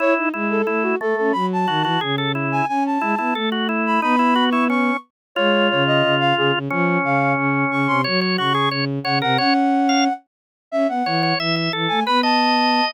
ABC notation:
X:1
M:4/4
L:1/8
Q:1/4=179
K:C#m
V:1 name="Flute"
c z2 A2 F A A | b a3 z3 g | g a3 z3 b | b3 c' c'2 z2 |
[K:Db] d2 d e2 f A z | z2 f2 z2 d' c' | z2 d'2 z2 g g | g5 z3 |
[K:C#m] e f3 z3 g | b a4 z3 |]
V:2 name="Drawbar Organ"
E2 E2 E2 A,2 | z2 F F G A E2 | z2 E E A F E2 | D E F E C2 z2 |
[K:Db] F8 | D8 | d d G A d z d B | d z2 f z4 |
[K:C#m] z2 c c e e A2 | B d5 z2 |]
V:3 name="Violin"
E D G,2 A,2 A, C | F,2 D, E, C,4 | C2 G, B, A,4 | B,6 z2 |
[K:Db] A,2 D,2 D,2 D, D, | F,2 D,2 D,2 D, C, | G,2 D,2 D,2 D, C, | D5 z3 |
[K:C#m] C B, E,2 E,2 E, A, | B,5 z3 |]